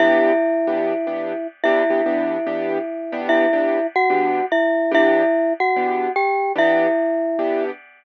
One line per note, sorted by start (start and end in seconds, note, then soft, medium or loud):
0.00 0.32 E3 medium
0.00 0.32 B3 medium
0.00 0.32 D4 medium
0.00 1.47 E4 loud
0.00 0.32 G4 loud
0.00 1.47 E5 loud
0.67 0.93 E3 medium
0.67 0.93 B3 medium
0.67 0.93 D4 medium
0.67 0.93 G4 medium
1.07 1.33 E3 medium
1.07 1.33 B3 medium
1.07 1.33 D4 medium
1.07 1.33 G4 medium
1.64 1.83 E3 loud
1.64 1.83 B3 medium
1.64 1.83 D4 loud
1.64 3.21 E4 medium
1.64 1.83 G4 medium
1.64 3.21 E5 medium
1.90 2.01 E3 medium
1.90 2.01 B3 medium
1.90 2.01 D4 medium
1.90 2.01 G4 medium
2.06 2.37 E3 medium
2.06 2.37 B3 medium
2.06 2.37 D4 medium
2.06 2.37 G4 medium
2.47 2.78 E3 medium
2.47 2.78 B3 medium
2.47 2.78 D4 medium
2.47 2.78 G4 medium
3.12 3.46 E3 medium
3.12 3.46 B3 medium
3.12 3.46 D4 medium
3.12 3.46 G4 medium
3.29 3.87 E4 medium
3.29 3.87 E5 loud
3.53 3.79 E3 medium
3.53 3.79 B3 medium
3.53 3.79 D4 medium
3.53 3.79 G4 medium
3.96 4.46 F#4 medium
3.96 4.46 F#5 medium
4.10 4.41 E3 medium
4.10 4.41 B3 medium
4.10 4.41 D4 medium
4.10 4.41 G4 medium
4.52 4.92 E4 medium
4.52 4.92 E5 medium
4.91 5.23 E3 medium
4.91 5.23 B3 medium
4.91 5.23 D4 medium
4.91 5.53 E4 loud
4.91 5.23 G4 loud
4.91 5.53 E5 loud
5.60 6.12 F#4 medium
5.60 6.12 F#5 medium
5.76 6.08 E3 medium
5.76 6.08 B3 medium
5.76 6.08 D4 medium
5.76 6.08 G4 medium
6.16 6.52 G4 medium
6.16 6.52 G5 medium
6.55 6.87 E3 medium
6.55 6.87 B3 medium
6.55 6.87 D4 loud
6.55 7.64 E4 medium
6.55 6.87 G4 medium
6.55 7.64 E5 loud
7.39 7.70 E3 medium
7.39 7.70 B3 medium
7.39 7.70 D4 medium
7.39 7.70 G4 medium